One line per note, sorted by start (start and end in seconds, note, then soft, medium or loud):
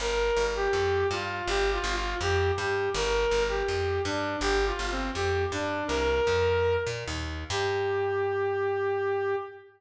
0.00 0.31 G1 medium
0.00 0.44 A#4 loud
0.37 0.68 G1 medium
0.56 1.07 G4 loud
0.73 1.04 F2 medium
1.11 1.42 G2 medium
1.11 1.45 F4 loud
1.47 1.79 G1 medium
1.47 1.70 G4 loud
1.73 1.93 F4 loud
1.84 2.15 G1 medium
1.95 2.15 F4 loud
2.21 2.52 F2 medium
2.21 2.51 G4 loud
2.58 2.89 G2 medium
2.58 2.90 G4 loud
2.94 3.26 G1 loud
2.94 3.43 A#4 loud
3.31 3.63 G1 medium
3.49 4.02 G4 medium
3.68 4.00 F2 medium
4.05 4.36 G2 medium
4.05 4.37 D4 loud
4.41 4.72 G1 medium
4.41 4.65 G4 loud
4.66 4.87 F4 medium
4.79 5.10 G1 medium
4.91 5.11 C4 loud
5.14 5.46 F2 medium
5.14 5.44 G4 loud
5.52 5.83 G2 medium
5.52 5.84 D4 loud
5.87 6.21 C2 medium
5.87 6.76 A#4 loud
6.27 6.77 F2 medium
6.87 7.04 A#2 medium
7.08 7.44 D#2 medium
7.50 9.35 G2 loud
7.50 9.35 G4 loud